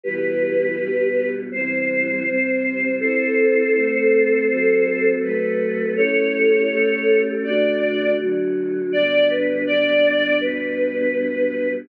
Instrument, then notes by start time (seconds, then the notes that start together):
choir aahs
0.04 B2 E3 G3 G4 B4
0.77 B2 G3 B3
1.51 C3 E3 G3 C5
2.25 C3 G3 C4
3.00 C4 E4 A4 C5
3.74 A3 C4 A4
4.49 F#3 C4 A4
5.22 F#3 A3 A4 B4
5.96 A3 C#4 E4 G4 A4 C#5
6.70 A3 C#4 G4 A4
7.44 D3 A3 F#4 D5
8.18 D3 F#3 F#4
8.92 G2 D3 B3 D5
9.29 B4
9.66 D5
10.41 G2 B2 B3 B4